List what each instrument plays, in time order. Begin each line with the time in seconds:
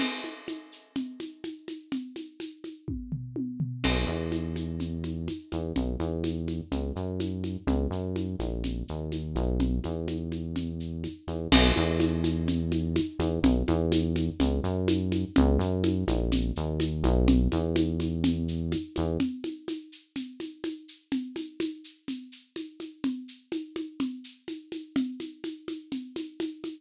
0.00 crash, low conga, shaker
0.24 high conga, shaker
0.48 high conga, shaker
0.72 shaker
0.96 low conga, shaker
1.20 high conga, shaker
1.44 high conga, shaker
1.68 high conga, shaker
1.92 low conga, shaker
2.16 high conga, shaker
2.40 high conga, shaker
2.64 high conga, shaker
2.88 kick, high tom
3.12 floor tom
3.36 high tom
3.60 floor tom
3.84 synth bass 1 B1, crash, low conga, shaker
4.07 synth bass 1 E2, high conga, shaker
4.32 high conga, shaker
4.56 high conga, shaker
4.80 low conga, shaker
5.04 high conga, shaker
5.28 high conga, shaker
5.52 synth bass 1 E2, high conga, shaker
5.76 synth bass 1 B1, low conga, shaker
6.00 synth bass 1 E2, high conga, shaker
6.24 high conga, shaker
6.48 high conga, shaker
6.72 synth bass 1 C#2, low conga, shaker
6.96 synth bass 1 F#2, shaker
7.20 high conga, shaker
7.44 high conga, shaker
7.67 synth bass 1 C#2, low conga, shaker
7.90 synth bass 1 F#2, shaker
8.16 high conga, shaker
8.39 synth bass 1 A#1, high conga, shaker
8.64 low conga, shaker
8.88 synth bass 1 D#2, shaker
9.12 high conga, shaker
9.36 synth bass 1 B1, high conga, shaker
9.60 low conga, shaker
9.84 synth bass 1 E2, high conga, shaker
10.08 high conga, shaker
10.32 high conga, shaker
10.56 low conga, shaker
10.80 shaker
11.04 high conga, shaker
11.28 synth bass 1 E2, high conga, shaker
11.52 synth bass 1 B1, crash, low conga, shaker
11.76 synth bass 1 E2, high conga, shaker
12.00 high conga, shaker
12.24 high conga, shaker
12.48 low conga, shaker
12.72 high conga, shaker
12.96 high conga, shaker
13.19 synth bass 1 E2, high conga, shaker
13.43 synth bass 1 B1, low conga, shaker
13.68 synth bass 1 E2, high conga, shaker
13.92 high conga, shaker
14.16 high conga, shaker
14.40 synth bass 1 C#2, low conga, shaker
14.63 synth bass 1 F#2, shaker
14.88 high conga, shaker
15.12 high conga, shaker
15.36 synth bass 1 C#2, low conga, shaker
15.59 synth bass 1 F#2, shaker
15.84 high conga, shaker
16.08 synth bass 1 A#1, high conga, shaker
16.32 low conga, shaker
16.56 synth bass 1 D#2, shaker
16.80 high conga, shaker
17.04 synth bass 1 B1, high conga, shaker
17.28 low conga, shaker
17.52 synth bass 1 E2, high conga, shaker
17.76 high conga, shaker
18.00 high conga, shaker
18.24 low conga, shaker
18.48 shaker
18.72 high conga, shaker
18.96 synth bass 1 E2, high conga, shaker
19.20 low conga, shaker
19.44 high conga, shaker
19.68 high conga, shaker
19.92 shaker
20.16 low conga, shaker
20.40 high conga, shaker
20.64 high conga, shaker
20.88 shaker
21.12 low conga, shaker
21.36 high conga, shaker
21.60 high conga, shaker
21.84 shaker
22.08 low conga, shaker
22.32 shaker
22.56 high conga, shaker
22.80 high conga, shaker
23.04 low conga, shaker
23.28 shaker
23.52 high conga, shaker
23.76 high conga, shaker
24.00 low conga, shaker
24.24 shaker
24.48 high conga, shaker
24.72 high conga, shaker
24.96 low conga, shaker
25.20 high conga, shaker
25.44 high conga, shaker
25.68 high conga, shaker
25.92 low conga, shaker
26.16 high conga, shaker
26.40 high conga, shaker
26.64 high conga, shaker